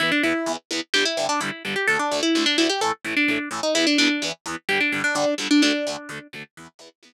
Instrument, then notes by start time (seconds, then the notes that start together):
acoustic guitar (steel)
0.00 E2 E3 B3 E4
0.12 D4
0.23 E2 E3 B3 E4
0.46 E2 E3 B3
0.71 E2 E3 B3
0.94 G2 D3 G3 G4
1.05 E4
1.17 G2 D3 G3
1.29 D4
1.40 G2 D3 G3 E4
1.65 G2 D3 G3
1.76 G4
1.88 D2 D3 A3 A4
1.99 D4
2.12 D2 D3 A3
2.23 E4
2.35 D2 D3 A3
2.46 D4
2.58 D2 D3 A3 E4
2.69 G4
2.81 A2 E3 A3 A4
3.04 A2 E3 A3
3.17 D4
3.28 A2 E3 A3
3.51 A2 E3 A3
3.63 D#4
3.75 E2 E3 B3 E4
3.87 D4
3.98 E2 E3 B3 D4
4.22 E2 E3 B3
4.46 E2 E3 B3
4.69 G2 D3 G3 G4
4.80 D4
4.92 G2 D3 G3
5.04 D4
5.15 G2 D3 G3 D4
5.38 G2 D3 G3
5.51 D4
5.62 D2 D3 A3 D4
5.87 D2 D3 A3
6.09 D2 D3 A3
6.33 D2 D3 A3
6.57 E2 E3 B3
6.79 E2 E3 B3
7.03 E2 E3 B3